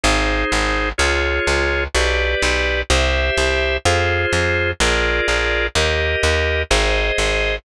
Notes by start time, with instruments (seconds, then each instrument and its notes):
0.04 electric bass (finger) G#1, drawbar organ D#4 G#4 C5
0.52 electric bass (finger) G#1
0.98 electric bass (finger) C#2, drawbar organ F4 G#4 C#5
1.47 electric bass (finger) C#2
1.95 electric bass (finger) B1, drawbar organ G4 B4 D5
2.42 electric bass (finger) B1
2.90 electric bass (finger) C2, drawbar organ G4 C5 E5
3.38 electric bass (finger) C2
3.85 electric bass (finger) F2, drawbar organ F4 G#4 C5
4.33 electric bass (finger) F2
4.80 electric bass (finger) A#1, drawbar organ F4 G#4 A#4 D5
5.28 electric bass (finger) A#1
5.75 electric bass (finger) D#2, drawbar organ G4 A#4 D#5
6.23 electric bass (finger) D#2
6.70 electric bass (finger) G#1, drawbar organ G#4 C5 D#5
7.18 electric bass (finger) G#1